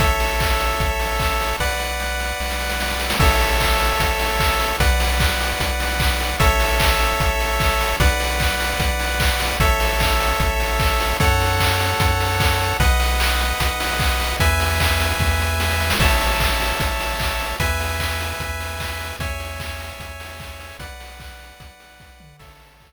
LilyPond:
<<
  \new Staff \with { instrumentName = "Lead 1 (square)" } { \time 4/4 \key a \major \tempo 4 = 150 <a' cis'' e''>1 | <b' d'' fis''>1 | <a' cis'' e''>1 | <b' d'' fis''>1 |
<a' cis'' e''>1 | <b' d'' fis''>1 | <a' cis'' e''>1 | <a' cis'' fis''>1 |
<b' dis'' fis''>1 | <b' e'' gis''>1 | <cis'' e'' a''>1 | <b' e'' gis''>1 |
<cis'' e'' gis''>1 | <b' d'' fis''>1 | <a' cis'' e''>1 | }
  \new Staff \with { instrumentName = "Synth Bass 1" } { \clef bass \time 4/4 \key a \major a,,2 a,,2 | b,,2 b,,2 | a,,2 a,,2 | b,,2 b,,2 |
a,,2 a,,2 | b,,2 b,,2 | a,,2 a,,2 | fis,2 fis,2 |
b,,2 b,,2 | e,2 e,2 | a,,2 a,,2 | e,2 e,2 |
e,2 e,2 | b,,2 b,,2 | a,,2 r2 | }
  \new DrumStaff \with { instrumentName = "Drums" } \drummode { \time 4/4 <hh bd>8 hho8 <hc bd>8 hho8 <hh bd>8 hho8 <hc bd>8 hho8 | <bd sn>8 sn8 sn8 sn8 sn16 sn16 sn16 sn16 sn16 sn16 sn16 sn16 | <cymc bd>8 hho8 <hc bd>8 hho8 <hh bd>8 hho8 <hc bd>8 hho8 | <hh bd>8 hho8 <hc bd>8 hho8 <hh bd>8 hho8 <hc bd>8 hho8 |
<hh bd>8 hho8 <hc bd>8 hho8 <hh bd>8 hho8 <hc bd>8 hho8 | <hh bd>8 hho8 <hc bd>8 hho8 <hh bd>8 hho8 <hc bd>8 hho8 | <hh bd>8 hho8 <hc bd>8 hho8 <hh bd>8 hho8 <hc bd>8 hho8 | <hh bd>8 hho8 <hc bd>8 hho8 <hh bd>8 hho8 <hc bd>8 hho8 |
<hh bd>8 hho8 hc8 hho8 <hh bd>8 hho8 <hc bd>8 hho8 | <hh bd>8 hho8 <hc bd>8 hho8 <bd sn>8 sn8 sn16 sn16 sn16 sn16 | <cymc bd>8 hho8 <hc bd>8 hho8 <hh bd>8 hho8 <hc bd>8 hho8 | <hh bd>8 hho8 <hc bd>8 hho8 <hh bd>8 hho8 <hc bd>8 hho8 |
<hh bd>8 hho8 <hc bd>8 hho8 <hh bd>8 hho8 <hc bd>8 hho8 | <hh bd>8 hho8 <hc bd>8 hho8 <hh bd>8 hho8 <bd sn>8 toml8 | <cymc bd>8 hho8 <hc bd>4 r4 r4 | }
>>